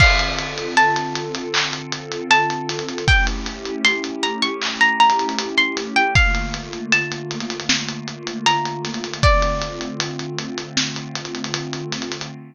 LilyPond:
<<
  \new Staff \with { instrumentName = "Pizzicato Strings" } { \time 4/4 \key d \minor \tempo 4 = 78 f''4 a''2 a''4 | g''16 r8. c'''16 r16 bes''16 cis'''8 bes''16 bes''8. c'''16 r16 g''16 | f''4 a''2 bes''4 | d''4. r2 r8 | }
  \new Staff \with { instrumentName = "Pad 2 (warm)" } { \time 4/4 \key d \minor <d c' f' a'>1 | <a cis' e' g'>1 | <d a bes f'>1 | <d a c' f'>1 | }
  \new DrumStaff \with { instrumentName = "Drums" } \drummode { \time 4/4 <cymc bd>16 hh16 hh16 hh16 hh16 hh16 hh16 hh16 hc16 hh16 hh16 hh16 hh16 hh16 <hh sn>32 hh32 hh32 hh32 | <hh bd>16 hh16 <hh sn>16 hh16 hh16 hh16 hh16 hh16 hc16 hh16 hh32 hh32 hh32 hh32 hh16 hh16 <hh sn>16 hh16 | <hh bd>16 hh16 hh16 hh16 hh16 hh16 hh32 hh32 hh32 hh32 sn16 hh16 hh16 hh16 hh16 hh16 <hh sn>32 hh32 hh32 hh32 | <hh bd>16 hh16 hh16 hh16 hh16 hh16 hh16 hh16 sn16 hh16 hh32 hh32 hh32 hh32 hh16 hh16 <hh sn>32 hh32 <hh sn>32 hh32 | }
>>